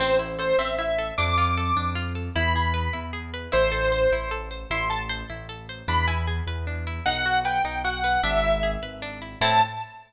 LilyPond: <<
  \new Staff \with { instrumentName = "Acoustic Grand Piano" } { \time 6/8 \key a \minor \tempo 4. = 102 c''8 r8 c''8 e''8 e''4 | d'''2 r4 | b''2 r4 | c''2 r4 |
c'''8 a''16 r2 r16 | b''8 gis''16 r2 r16 | fis''4 g''4 fis''4 | e''4. r4. |
a''4. r4. | }
  \new Staff \with { instrumentName = "Orchestral Harp" } { \time 6/8 \key a \minor c'8 e'8 a'8 c'8 e'8 a'8 | d'8 f'8 a'8 d'8 f'8 a'8 | e'8 gis'8 b'8 e'8 gis'8 b'8 | e'8 a'8 c''8 e'8 a'8 c''8 |
e'8 a'8 c''8 e'8 a'8 c''8 | d'8 e'8 gis'8 b'8 d'8 e'8 | dis'8 fis'8 b'8 dis'8 fis'8 b'8 | d'8 e'8 gis'8 b'8 d'8 e'8 |
<c' e' a'>4. r4. | }
  \new Staff \with { instrumentName = "Acoustic Grand Piano" } { \clef bass \time 6/8 \key a \minor a,,4. a,,4. | f,4. f,4. | e,4. e,4. | a,,4. a,,4. |
a,,4. a,,4. | e,4. e,4. | b,,4. b,,4. | gis,,4. gis,,4. |
a,4. r4. | }
>>